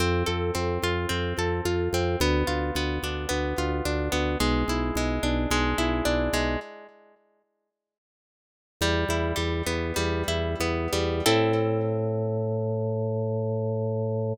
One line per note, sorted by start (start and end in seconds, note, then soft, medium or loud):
0.00 0.23 F2 loud
0.00 0.54 C4 loud
0.26 0.51 F2 loud
0.26 1.38 A4 medium
0.55 0.78 F2 medium
0.55 1.09 C4 medium
0.83 1.06 F2 medium
0.83 1.65 F4 medium
1.09 1.33 F2 medium
1.09 1.93 C4 medium
1.38 1.61 F2 loud
1.38 2.17 A4 medium
1.65 1.89 F2 medium
1.65 2.18 F4 medium
1.93 2.16 F2 loud
1.93 2.20 C4 medium
2.20 2.43 D2 loud
2.20 2.76 B3 loud
2.47 2.71 D2 medium
2.47 3.58 F4 medium
2.75 2.99 D2 medium
2.75 3.28 B3 medium
3.03 3.26 D2 medium
3.03 3.85 D4 medium
3.29 3.54 D2 medium
3.29 4.11 B3 medium
3.58 3.81 D2 medium
3.58 4.37 F4 medium
3.85 4.09 D2 loud
3.85 4.38 D4 medium
4.12 4.36 D2 loud
4.12 4.38 B3 medium
4.40 4.64 B1 loud
4.40 4.96 G#3 loud
4.68 4.91 B1 medium
4.68 5.78 E4 medium
4.95 5.19 B1 loud
4.95 5.51 G#3 medium
5.23 5.46 B1 loud
5.23 6.05 D4 medium
5.51 5.74 B1 loud
5.51 6.33 G#3 loud
5.78 6.01 B1 medium
5.78 6.57 E4 medium
6.05 6.29 B1 medium
6.05 6.57 D4 medium
6.33 6.56 B1 medium
6.33 6.60 G#3 medium
8.81 9.04 E2 loud
8.81 9.35 G3 loud
9.09 9.33 E2 loud
9.09 10.28 E4 medium
9.36 9.62 E2 loud
9.36 9.96 G3 medium
9.67 9.92 E2 medium
9.67 10.60 B3 medium
9.96 10.23 E2 loud
9.96 10.92 G3 medium
10.28 10.55 E2 loud
10.28 11.22 E4 medium
10.60 10.88 E2 medium
10.60 11.24 B3 medium
10.93 11.22 E2 medium
10.93 11.25 G3 medium
11.26 14.33 A2 loud
11.26 14.32 C4 loud
11.26 14.32 E4 loud
11.26 14.32 A4 loud